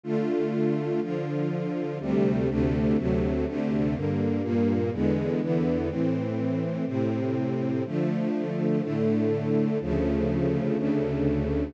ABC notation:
X:1
M:6/8
L:1/8
Q:3/8=123
K:Dm
V:1 name="String Ensemble 1"
[D,A,F]6 | [D,F,F]6 | [D,,C,G,A,]3 [D,,C,D,A,]3 | [D,,C,^F,A,]3 [D,,C,D,A,]3 |
[G,,D,B,]3 [G,,B,,B,]3 | [E,,D,^G,=B,]3 [E,,D,E,B,]3 | [A,,E,C]6 | [A,,C,C]6 |
[D,F,A,]6 | [A,,D,A,]6 | [D,,^C,F,A,]6 | [D,,^C,D,A,]6 |]